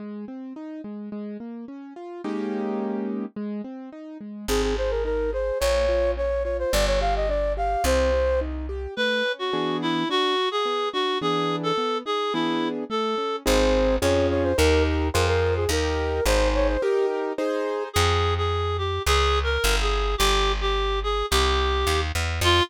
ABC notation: X:1
M:2/4
L:1/16
Q:1/4=107
K:Ab
V:1 name="Flute"
z8 | z8 | z8 | z8 |
A A c B B2 c2 | d4 d2 d c | =d _d f e =d2 f2 | c4 z4 |
[K:A] z8 | z8 | z8 | z8 |
[K:Ab] c4 d2 d c | B2 z2 B B2 A | B4 c2 d c | G2 z2 A4 |
[K:Fm] z8 | z8 | z8 | z8 |
z8 |]
V:2 name="Clarinet"
z8 | z8 | z8 | z8 |
z8 | z8 | z8 | z8 |
[K:A] B3 F3 E2 | F3 G3 F2 | G3 A3 G2 | E3 z A4 |
[K:Ab] z8 | z8 | z8 | z8 |
[K:Fm] A3 A3 G2 | (3A4 B4 A4 | G3 G3 A2 | G6 z2 |
F4 z4 |]
V:3 name="Acoustic Grand Piano"
A,2 C2 E2 A,2 | A,2 B,2 D2 F2 | [A,B,DEG]8 | A,2 C2 E2 A,2 |
C2 A2 E2 A2 | B,2 F2 D2 F2 | =B,2 G2 =D2 G2 | C2 G2 E2 G2 |
[K:A] A,2 C2 [E,B,DG]4 | D2 F2 B,2 D2 | [E,B,DG]4 B,2 ^D2 | [E,B,DG]4 A,2 C2 |
[K:Ab] [CEA]4 [DFA]4 | [EGB]4 [FAc]4 | [EGB]4 [EAc]4 | [EGB]4 [EAc]4 |
[K:Fm] z8 | z8 | z8 | z8 |
z8 |]
V:4 name="Electric Bass (finger)" clef=bass
z8 | z8 | z8 | z8 |
A,,,8 | B,,,8 | G,,,8 | C,,8 |
[K:A] z8 | z8 | z8 | z8 |
[K:Ab] A,,,4 F,,4 | E,,4 F,,4 | E,,4 A,,,4 | z8 |
[K:Fm] F,,8 | D,,4 G,,,4 | G,,,8 | C,,4 E,,2 =E,,2 |
F,,4 z4 |]